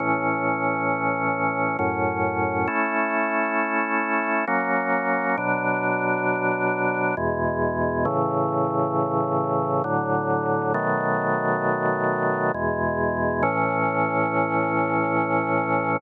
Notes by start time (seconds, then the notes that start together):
0.00 A2 E3 C#4
1.79 F#2 A2 C#4
2.68 A3 C#4 E4
4.47 F#3 A#3 C#4
5.37 B2 F#3 D4
7.17 E2 B2 G#3
8.05 A2 C#3 E3
9.84 A2 D3 F#3
10.74 B2 D#3 F#3 A3
12.54 E2 B2 G#3
13.43 A2 E3 C#4